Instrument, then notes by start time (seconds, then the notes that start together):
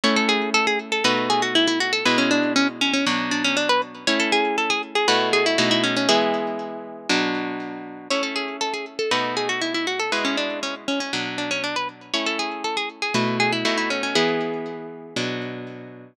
acoustic guitar (steel)
0.03 A3 C#4 E4 C#5
0.16 A4
0.29 G#4
0.54 A4
0.67 G#4
0.92 A4
1.04 B2 A3 D#4 F#4 B4
1.30 G#4
1.42 F#4
1.55 E4
1.67 E4
1.80 F#4
1.93 A4
2.05 B2 G#3 E4 B4
2.18 C#4
2.31 D4
2.56 C#4
2.81 C#4
2.93 C#4
3.06 B2 F#3 D4
3.31 D4
3.44 C#4
3.57 D4
3.69 B4
4.07 A3 C#4 E4 C#5
4.19 A4
4.32 G#4
4.58 A4
4.70 G#4
4.95 G#4
5.08 B2 A3 E4 F#4 B4
5.33 G#4
5.46 E4
5.58 B2 A3 D#4 E4 F#4
5.71 E4
5.83 C#4
5.96 C#4
6.09 E3 G#3 B3 E4 G#4
7.09 B2 F#3 D4
8.10 A3 C#4 E4 C#5
8.23 A4
8.35 G#4
8.61 A4
8.73 G#4
8.99 A4
9.11 B2 A3 D#4 F#4 B4
9.37 G#4
9.49 F#4
9.61 E4
9.74 E4
9.87 F#4
9.99 A4
10.12 B2 G#3 E4 B4
10.24 C#4
10.37 D4
10.63 C#4
10.88 C#4
11.00 C#4
11.13 B2 F#3 D4
11.38 D4
11.51 C#4
11.63 D4
11.76 B4
12.13 A3 C#4 E4 C#5
12.26 A4
12.39 G#4
12.64 A4
12.77 G#4
13.02 G#4
13.14 B2 A3 E4 F#4 B4
13.40 G#4
13.52 E4
13.65 B2 A3 D#4 E4 F#4
13.77 E4
13.90 C#4
14.03 C#4
14.15 E3 G#3 B3 E4 G#4
15.16 B2 F#3 D4